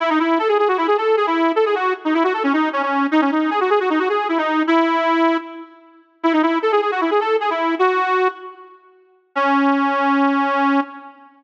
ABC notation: X:1
M:4/4
L:1/16
Q:1/4=154
K:C#m
V:1 name="Accordion"
E D E2 A G G F E G A2 G E3 | A G F2 z D E F A C D2 C C3 | D C D2 G F G F D F G2 E D3 | E8 z8 |
E D E2 A G G F E G A2 G E3 | F6 z10 | C16 |]